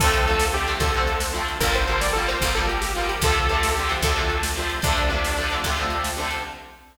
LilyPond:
<<
  \new Staff \with { instrumentName = "Lead 2 (sawtooth)" } { \time 12/8 \key d \minor \tempo 4. = 149 a'2 g'4 a'4. r4. | bes'8 c''4 d''8 a'8 c''4 a'8 g'8 g'8 f'8 g'8 | a'2 g'4 a'4. r4. | d'2. r2. | }
  \new Staff \with { instrumentName = "Acoustic Guitar (steel)" } { \time 12/8 \key d \minor <d f a c'>4 <d f a c'>4 <d f a c'>8 <d f a c'>8 <d f a c'>8 <d f a c'>4. <d f a c'>4 | <d f g bes>4 <d f g bes>4 <d f g bes>8 <d f g bes>8 <d f g bes>8 <d f g bes>4. <d f g bes>4 | <c d f a>4 <c d f a>4 <c d f a>8 <c d f a>8 <c d f a>8 <c d f a>4. <c d f a>4 | <c d f a>4 <c d f a>4 <c d f a>8 <c d f a>8 <c d f a>8 <c d f a>4. <c d f a>4 | }
  \new Staff \with { instrumentName = "Electric Bass (finger)" } { \clef bass \time 12/8 \key d \minor d,2. d,2. | g,,2. g,,2. | d,2. d,2. | d,2. d,2. | }
  \new DrumStaff \with { instrumentName = "Drums" } \drummode { \time 12/8 <cymc bd>8 cymr8 cymr8 sn8 cymr8 cymr8 <bd cymr>8 cymr8 cymr8 sn8 cymr8 cymr8 | <bd cymr>8 cymr8 cymr8 sn8 cymr8 cymr8 <bd cymr>8 cymr8 cymr8 sn8 cymr8 cymr8 | <bd cymr>8 cymr8 cymr8 sn8 cymr8 cymr8 <bd cymr>8 cymr8 cymr8 sn8 cymr8 cymr8 | <bd cymr>8 cymr8 cymr8 sn8 cymr8 cymr8 <bd cymr>8 cymr8 cymr8 sn8 cymr8 cymr8 | }
>>